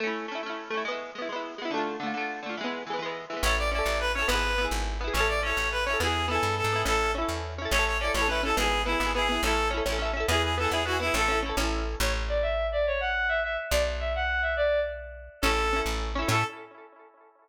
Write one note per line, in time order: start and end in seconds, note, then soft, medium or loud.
0.00 0.26 A3 medium
0.00 0.26 C#4 medium
0.07 0.26 E4 medium
0.28 0.41 A3 medium
0.28 0.41 C#4 medium
0.35 0.41 E4 medium
0.43 0.69 A3 medium
0.43 0.69 C#4 medium
0.50 0.69 E4 soft
0.70 0.84 A3 medium
0.70 0.84 C#4 medium
0.77 0.84 E4 medium
0.85 1.11 G#3 medium
0.85 1.11 B3 medium
0.92 1.11 E4 medium
1.15 1.28 G#3 medium
1.15 1.28 B3 medium
1.22 1.28 E4 medium
1.29 1.55 G#3 medium
1.29 1.55 B3 medium
1.36 1.55 E4 medium
1.58 1.71 G#3 medium
1.58 1.71 B3 medium
1.65 1.71 E4 medium
1.71 1.97 D3 medium
1.71 1.97 A3 medium
1.77 1.97 F4 medium
2.00 2.13 D3 medium
2.00 2.13 A3 medium
2.06 2.13 F4 medium
2.14 2.40 D3 medium
2.14 2.40 A3 medium
2.21 2.40 F4 medium
2.43 2.56 D3 medium
2.43 2.56 A3 medium
2.49 2.56 F4 medium
2.57 2.84 E3 medium
2.57 2.84 G#3 medium
2.64 2.84 B3 medium
2.87 2.98 E3 medium
2.87 3.00 G#3 medium
2.93 3.00 B3 medium
2.99 3.25 E3 medium
2.99 3.25 G#3 medium
3.06 3.25 B3 soft
3.30 3.43 E3 medium
3.30 3.43 G#3 medium
3.37 3.43 B3 medium
3.43 3.82 A1 loud
3.43 3.69 C#4 medium
3.43 3.69 E4 medium
3.43 3.55 C#5 medium
3.49 3.69 A4 loud
3.58 3.70 D5 medium
3.72 4.11 C#4 medium
3.72 4.11 E4 medium
3.72 3.98 D5 medium
3.79 4.11 A4 medium
3.86 4.24 A1 medium
4.00 4.12 B4 medium
4.14 4.28 C#4 medium
4.14 4.27 C#5 medium
4.19 4.28 E4 medium
4.19 4.28 A4 medium
4.28 4.67 G#1 loud
4.28 4.54 B3 medium
4.28 4.54 E4 medium
4.28 4.65 B4 medium
4.35 4.54 G#4 medium
4.58 4.97 B3 medium
4.58 4.97 E4 medium
4.65 4.97 G#4 medium
4.71 5.10 G#1 medium
5.01 5.14 B3 medium
5.01 5.14 E4 medium
5.07 5.14 G#4 medium
5.14 5.53 A1 medium
5.14 5.40 C#4 medium
5.14 5.40 E4 medium
5.14 5.27 C#5 medium
5.20 5.40 A4 medium
5.28 5.41 D5 medium
5.43 5.82 C#4 medium
5.43 5.82 E4 medium
5.43 5.69 C#5 medium
5.50 5.82 A4 medium
5.57 5.96 A1 medium
5.71 5.84 B4 medium
5.85 6.00 C#4 medium
5.85 5.97 C#5 medium
5.90 6.00 E4 medium
5.90 6.00 A4 medium
6.00 6.39 E2 medium
6.00 6.26 B3 medium
6.00 6.26 E4 medium
6.00 6.26 G#4 medium
6.07 6.26 G#4 medium
6.28 6.67 B3 medium
6.28 6.67 E4 medium
6.28 6.55 A4 medium
6.35 6.67 G#4 medium
6.43 6.62 G2 medium
6.57 6.82 A4 medium
6.64 6.84 G#2 medium
6.72 6.85 B3 medium
6.72 6.85 E4 medium
6.79 6.85 G#4 medium
6.85 7.24 A1 medium
6.85 7.11 C#4 medium
6.85 7.11 E4 medium
6.85 7.11 A4 loud
6.92 7.11 A4 loud
7.15 7.54 C#4 medium
7.15 7.54 E4 medium
7.22 7.54 A4 medium
7.29 7.67 E2 medium
7.58 7.71 C#4 medium
7.58 7.71 E4 medium
7.65 7.71 A4 medium
7.71 8.10 A1 loud
7.71 7.98 C#4 medium
7.71 7.85 C#5 loud
7.75 7.98 E4 medium
7.75 7.98 A4 loud
7.86 7.97 C#5 medium
8.00 8.14 C#4 medium
8.00 8.11 D5 medium
8.04 8.14 E4 medium
8.04 8.14 A4 medium
8.14 8.53 A1 medium
8.14 8.27 C#4 medium
8.14 8.28 E4 medium
8.14 8.27 C#5 loud
8.22 8.28 A4 medium
8.28 8.41 C#4 medium
8.28 8.41 E4 medium
8.28 8.42 B4 medium
8.35 8.41 A4 medium
8.43 8.56 C#4 medium
8.43 8.56 E4 medium
8.43 8.55 A4 medium
8.50 8.56 A4 medium
8.57 8.96 G#1 loud
8.57 8.83 B3 medium
8.57 8.83 E4 loud
8.57 8.82 G#4 loud
8.64 8.83 G#4 medium
8.85 8.98 B3 medium
8.85 9.11 E4 medium
8.85 8.98 E4 medium
8.92 8.98 G#4 medium
9.00 9.39 G#1 medium
9.00 9.13 B3 medium
9.00 9.13 E4 medium
9.06 9.13 G#4 medium
9.14 9.28 B3 medium
9.14 9.28 E4 medium
9.14 9.41 G#4 medium
9.22 9.28 G#4 medium
9.29 9.42 B3 medium
9.29 9.42 E4 medium
9.36 9.42 G#4 medium
9.43 9.81 A1 loud
9.43 9.70 C#4 medium
9.43 9.68 A4 loud
9.47 9.70 E4 medium
9.47 9.70 A4 medium
9.71 9.84 C#4 medium
9.71 9.84 E4 medium
9.77 9.84 A4 medium
9.85 10.24 A1 medium
9.85 9.98 C#4 medium
9.85 9.99 E4 medium
9.92 9.99 A4 medium
9.99 10.12 C#4 medium
9.99 10.12 E4 medium
10.05 10.12 A4 medium
10.13 10.26 C#4 medium
10.13 10.26 E4 medium
10.20 10.26 A4 medium
10.28 10.67 E2 loud
10.28 10.55 B3 medium
10.28 10.55 E4 loud
10.28 10.42 G#4 loud
10.35 10.55 G#4 loud
10.43 10.55 G#4 medium
10.57 10.69 B3 medium
10.57 10.71 E4 medium
10.57 10.70 A4 medium
10.64 10.71 G#4 medium
10.70 11.10 E2 medium
10.70 10.83 B3 medium
10.70 10.83 E4 medium
10.70 10.84 G#4 medium
10.77 10.83 G#4 medium
10.85 10.99 B3 medium
10.85 10.99 E4 medium
10.85 10.97 F#4 loud
10.92 10.99 G#4 medium
11.00 11.13 B3 medium
11.00 11.14 E4 loud
11.00 11.13 E4 medium
11.06 11.13 G#4 medium
11.14 11.53 A1 loud
11.14 11.27 C#4 medium
11.14 11.27 E4 medium
11.14 11.39 A4 loud
11.21 11.27 A4 loud
11.28 11.41 C#4 medium
11.28 11.41 E4 medium
11.35 11.41 A4 medium
11.42 11.56 C#4 medium
11.42 11.56 E4 medium
11.49 11.56 A4 medium
11.57 11.96 A1 loud
11.57 11.97 C#4 medium
11.57 11.97 E4 medium
11.64 11.97 A4 medium
12.00 13.58 A1 loud
12.00 12.13 C#5 loud
12.29 12.42 D5 loud
12.42 12.67 E5 loud
12.72 12.86 D5 loud
12.87 13.00 C#5 loud
13.00 13.28 F#5 loud
13.29 13.40 E5 loud
13.43 13.57 E5 loud
13.71 15.29 B1 loud
13.71 13.83 D5 loud
14.00 14.13 E5 loud
14.15 14.41 F#5 loud
14.42 14.54 E5 medium
14.57 14.80 D5 loud
15.42 15.82 A1 medium
15.42 15.69 C#4 medium
15.42 15.80 A4 loud
15.46 15.69 E4 loud
15.46 15.69 A4 medium
15.73 16.12 C#4 medium
15.73 16.12 E4 medium
15.80 16.12 A4 medium
15.86 16.24 A1 medium
16.15 16.28 C#4 medium
16.15 16.28 E4 medium
16.22 16.28 A4 medium
16.28 16.44 A2 loud
16.28 16.43 C#4 medium
16.28 16.43 E4 loud
16.28 16.44 A4 loud
16.35 16.43 A4 loud